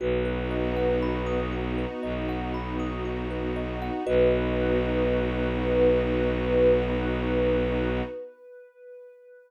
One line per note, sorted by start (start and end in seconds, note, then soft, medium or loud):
0.00 1.86 B1 loud
0.00 4.03 B3 loud
0.00 4.03 D#4 medium
0.00 4.03 F#4 medium
0.00 0.24 F#4 medium
0.00 1.41 B4 medium
0.25 0.48 B4 medium
0.51 0.74 D#5 medium
0.76 0.99 F#5 medium
1.03 1.25 B5 medium
1.26 1.49 D#6 medium
1.52 1.75 F#4 medium
1.78 2.01 B4 medium
2.03 3.90 B1 medium
2.03 2.26 D#5 medium
2.29 2.52 F#5 medium
2.54 2.77 B5 medium
2.79 3.02 D#6 medium
3.05 3.28 F#4 medium
3.31 3.53 B4 medium
3.56 3.79 D#5 medium
3.82 4.05 F#5 medium
4.06 8.02 B1 loud
4.06 8.02 B3 loud
4.06 8.02 D#4 loud
4.06 8.02 F#4 medium
4.06 8.02 F#4 loud
4.06 8.01 B4 loud
4.06 8.02 B4 loud
4.06 8.02 D#5 medium